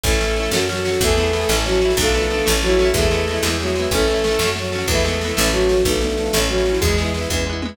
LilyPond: <<
  \new Staff \with { instrumentName = "Violin" } { \time 6/8 \key a \major \tempo 4. = 124 <a a'>2 <fis fis'>4 | <a a'>2 <fis fis'>4 | <a a'>2 <fis fis'>4 | <a a'>2 <fis fis'>4 |
<a a'>2 <fis fis'>4 | <a a'>2 <fis fis'>4 | <a a'>2 <fis fis'>4 | <gis gis'>4 r2 | }
  \new Staff \with { instrumentName = "Acoustic Guitar (steel)" } { \time 6/8 \key a \major <cis' e' a'>8 <cis' e' a'>8 <cis' e' a'>8 <cis' fis' a'>8 <cis' fis' a'>8 <cis' fis' a'>8 | <b e' gis'>8 <b e' gis'>8 <b e' gis'>8 <cis' e' a'>8 <cis' e' a'>8 <cis' e' a'>8 | <b d' f'>8 <b d' f'>8 <b d' f'>8 <a cis' e'>8 <a cis' e'>8 <a cis' e'>8 | <gis b e'>8 <gis b e'>8 <gis b e'>8 <gis b e'>8 <gis b e'>8 <gis b e'>8 |
<a cis' e'>8 <a cis' e'>8 <a cis' e'>8 <a cis' fis'>8 <a cis' fis'>8 <a cis' fis'>8 | <gis b e'>8 <gis b e'>8 <gis b e'>8 <a cis' e'>8 <a cis' e'>8 <a cis' e'>8 | <b d' f'>8 <b d' f'>8 <b d' f'>8 <a cis' e'>8 <a cis' e'>8 <a cis' e'>8 | <gis b e'>8 <gis b e'>8 <gis b e'>8 <gis b e'>8 <gis b e'>8 <gis b e'>8 | }
  \new Staff \with { instrumentName = "Electric Bass (finger)" } { \clef bass \time 6/8 \key a \major a,,4. fis,4. | e,4. a,,4. | b,,4. a,,4. | e,4. e,4. |
a,,4. fis,4. | e,4. a,,4. | b,,4. a,,4. | e,4. e,4. | }
  \new DrumStaff \with { instrumentName = "Drums" } \drummode { \time 6/8 <bd sn>16 sn16 sn16 sn16 sn16 sn16 sn16 sn16 sn16 sn16 sn16 sn16 | <bd sn>16 sn16 sn16 sn16 sn16 sn16 sn16 sn16 sn16 sn16 sn16 sn16 | <bd sn>16 sn16 sn16 sn16 sn16 sn16 sn16 sn16 sn16 sn16 sn16 sn16 | <bd sn>16 sn16 sn16 sn16 sn16 sn16 sn16 sn16 sn16 sn16 sn16 sn16 |
<bd sn>16 sn16 sn16 sn16 sn16 sn16 sn16 sn16 sn16 sn16 sn16 sn16 | <bd sn>16 sn16 sn16 sn16 sn16 sn16 sn16 sn16 sn16 sn16 sn16 sn16 | <bd sn>16 sn16 sn16 sn16 sn16 sn16 sn16 sn16 sn16 sn16 sn16 sn16 | <bd sn>16 sn16 sn16 sn16 sn16 sn16 <bd tommh>4 toml8 | }
>>